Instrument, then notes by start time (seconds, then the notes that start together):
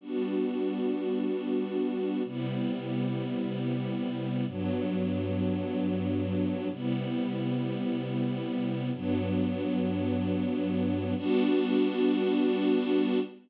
string ensemble 1
0.01 G3 B3 D4 F#4
2.24 C3 G3 B3 E4
4.47 G2 F#3 B3 D4
6.70 C3 G3 B3 E4
8.93 G2 F#3 B3 D4
11.17 G3 B3 D4 F#4